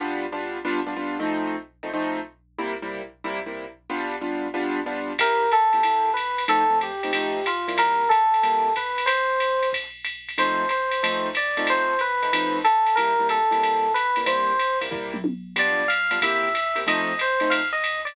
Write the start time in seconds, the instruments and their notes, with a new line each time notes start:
0.00 acoustic grand piano G3 B3 D4 F4
0.32 acoustic grand piano G3 B3 D4 F4
0.65 acoustic grand piano G3 B3 D4 F4
0.86 acoustic grand piano G3 B3 D4 F4
0.96 acoustic grand piano G3 B3 D4 F4
1.19 acoustic grand piano F3 A3 C4 D#4
1.83 acoustic grand piano F3 A3 C4 D#4
1.94 acoustic grand piano F3 A3 C4 D#4
2.59 acoustic grand piano C3 G3 A#3 E4
2.82 acoustic grand piano C3 G3 A#3 E4
3.24 acoustic grand piano C3 G3 A#3 E4
3.46 acoustic grand piano C3 G3 A#3 E4
3.90 acoustic grand piano G3 B3 D4 F4
4.21 acoustic grand piano G3 B3 D4 F4
4.54 acoustic grand piano G3 B3 D4 F4
4.86 acoustic grand piano G3 B3 D4 F4
5.18 acoustic grand piano C3 A#3 E4 G4, electric piano 1 A#4, kick, crash, ride
5.50 electric piano 1 A4, hi-hat pedal, ride
5.73 acoustic grand piano C3 A#3 E4 G4, ride
5.83 acoustic grand piano C3 A#3 E4 G4, ride
6.14 electric piano 1 B4, hi-hat pedal, ride
6.38 ride
6.48 acoustic grand piano F3 A3 C4 D#4, electric piano 1 A4, ride
6.70 acoustic grand piano F3 A3 C4 D#4
6.81 electric piano 1 G4, hi-hat pedal, ride
7.03 acoustic grand piano F3 A3 C4 D#4, ride
7.13 acoustic grand piano F3 A3 C4 D#4, ride
7.46 electric piano 1 F4, hi-hat pedal, ride
7.68 acoustic grand piano C3 G3 A#3 E4, ride
7.78 electric piano 1 A#4, ride
8.09 electric piano 1 A4, kick, hi-hat pedal, ride
8.34 ride
8.43 acoustic grand piano C3 G3 A#3 E4, kick, ride
8.75 electric piano 1 B4, kick, hi-hat pedal, ride
8.98 ride
9.06 electric piano 1 C5, ride
9.40 hi-hat pedal, ride
9.63 ride
9.73 kick, ride
10.05 hi-hat pedal, ride
10.29 ride
10.38 acoustic grand piano F3 A3 C4 D#4, electric piano 1 C5, ride
10.69 electric piano 1 C5, hi-hat pedal, ride
10.91 ride
11.03 acoustic grand piano F3 A3 C4 D#4, ride
11.34 electric piano 1 D5, hi-hat pedal, ride
11.57 acoustic grand piano F3 A3 C4 D#4, ride
11.67 electric piano 1 C5, ride
11.99 electric piano 1 B4, hi-hat pedal, ride
12.22 acoustic grand piano F3 A3 C4 D#4, ride
12.33 acoustic grand piano F3 A3 C4 D#4, ride
12.64 electric piano 1 A4, hi-hat pedal, ride
12.86 ride
12.95 acoustic grand piano C3 G3 A#3 E4, electric piano 1 A#4, ride
13.19 acoustic grand piano C3 G3 A#3 E4
13.29 electric piano 1 A4, hi-hat pedal, ride
13.51 acoustic grand piano C3 G3 A#3 E4, ride
13.63 ride
13.94 electric piano 1 B4, hi-hat pedal, ride
14.16 acoustic grand piano C3 G3 A#3 E4, ride
14.26 acoustic grand piano C3 G3 A#3 E4, electric piano 1 C5, ride
14.59 hi-hat pedal, ride
14.81 acoustic grand piano C3 G3 A#3 E4, ride
14.91 acoustic grand piano C3 G3 A#3 E4, kick, floor tom
15.14 mid tom
15.24 high tom
15.56 acoustic grand piano G3 B3 D4 F4, electric piano 1 D5, crash, ride
15.88 electric piano 1 F5, hi-hat pedal, ride
16.11 acoustic grand piano G3 B3 D4 F4, ride
16.22 acoustic grand piano C3 A#3 E4 G4, electric piano 1 E5, kick, ride
16.54 hi-hat pedal, ride
16.75 acoustic grand piano C3 A#3 E4 G4, ride
16.87 acoustic grand piano F3 A3 C4 D#4, electric piano 1 D#5, ride
17.19 electric piano 1 C5, hi-hat pedal, ride
17.40 acoustic grand piano F3 A3 C4 D#4, ride
17.50 electric piano 1 F5, ride
17.72 electric piano 1 D#5
17.84 hi-hat pedal, ride
18.05 electric piano 1 D5, ride